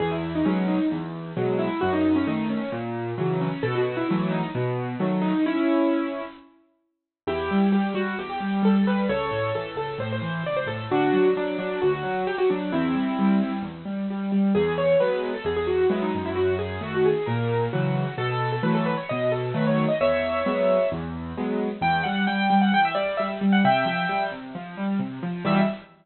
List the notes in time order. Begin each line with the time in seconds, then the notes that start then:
0.00 E2 G#4
0.11 E4
0.35 D#4
0.45 B2 F#3 G#3 C#4
0.68 D#4
0.91 E2
1.37 B2 F#3 G#3
1.59 E4
1.81 F#2 F#4
1.93 D#4
2.16 C#4
2.27 D#3 A3 D#4
2.50 C#4
2.72 A#2
3.18 C#3 E3 F#3
3.41 C#4
3.63 B2 A4
3.75 F#4
3.97 E4
4.09 E3 F#3 A3 E4
4.31 D#4
4.55 B2
5.00 D#3 F#3 A3
5.21 D#4
5.46 C#4 E4
7.27 E2 E4 G4
7.51 G3
7.72 G3 G4
7.94 G3 F#4
8.19 E2 G4
8.30 G4
8.40 G3
8.63 G3 A4
8.75 A4
8.87 G3 B4
9.09 C#2 A4 C#5
9.31 A2
9.55 E3 A4
9.76 C#2 A4
9.98 A2 C5
10.12 C5
10.22 E3
10.44 C#2 D5
10.56 C5
10.66 A2 A4
10.90 D2 D4 F#4
11.13 F#3
11.37 F#3 D4
11.58 F#3 D4
11.82 D2 F#4
11.93 F#4
12.03 F#3
12.27 F#3 G4
12.38 F#4
12.50 F#3 D4
12.72 E2 C4 E4
12.94 G3
13.19 G3
13.42 G3
13.62 E2
13.85 G3
14.10 G3
14.32 G3
14.55 E2 G#4
14.78 C#5
15.00 F#3 G#3 B3 B4
15.34 A4
15.44 E2 G#4
15.56 G#4
15.67 F#4
15.90 F#3 G#3 B3 E4
16.02 D#4
16.15 F#2
16.26 E4
16.36 F#4
16.59 G#4
16.81 D#3 A3 F#4
16.94 F#4
17.05 G#4
17.26 A#2 A#4
17.73 C#3 E3 F#3 F#4
18.18 B2 A4
18.52 A4
18.63 E3 F#3 A3 B4
18.75 A4
18.86 B4
18.97 C#5
19.09 B2 D#5
19.32 A4
19.54 D#3 F#3 A3 B4
19.67 C#5
19.88 D#5
20.01 E2 C#5 E5
20.46 F#3 G#3 B3
20.92 E2
21.37 F#3 G#3 B3
21.81 E2 G5
22.03 G3 F#5
22.27 G3 G5
22.50 G3
22.61 F#5
22.71 E2 G5
22.85 E5
22.95 G3 D5
23.17 G3 E5
23.41 G3
23.52 F#5
23.64 C3 E5 G5
23.86 F3
24.09 G3
24.31 C3
24.55 F3
24.77 G3
24.99 C3
25.23 F3
25.45 E2 B2 G3 E5